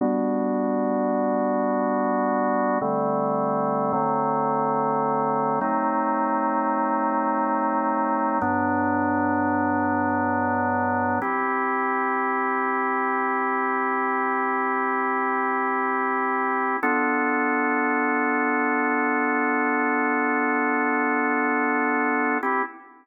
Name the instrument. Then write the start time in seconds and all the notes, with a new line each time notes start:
drawbar organ
0.01 G3 B3 D4 F#4
2.81 D3 G3 A3 C4
3.93 D3 F#3 A3 C4
5.61 F#3 A3 C4 D#4
8.41 G2 F#3 B3 D4
11.22 C4 E4 G4
16.83 B3 D4 F4 A4
22.43 C4 E4 G4